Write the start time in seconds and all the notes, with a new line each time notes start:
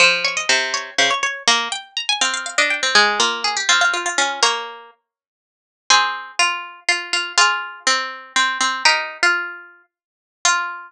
0.00 F3 C5
0.24 C#5
0.37 D#5
0.49 C3 C5
0.74 C#5
0.98 C#3 C5
1.10 C#5
1.23 C#5
1.48 A#3 A#5
1.72 G5
1.97 A#5
2.09 G#5
2.21 C4 F5
2.34 F5
2.46 F5
2.58 D4 D#5
2.70 G5
2.83 C4
2.95 G#3 G#4
3.20 A#3 F4
3.44 G#4
3.57 G4
3.69 C4 F4
3.81 F4
3.94 F4
4.06 F4
4.18 C#4 F4
4.43 A#3 A#4 C#5
5.90 C4 G#4 C5
6.39 F4
6.89 F4
7.13 F4
7.38 F4 G#4
7.87 C4
8.36 C4
8.61 C4
8.85 D#4 G4 A#4
9.23 F4
10.45 F4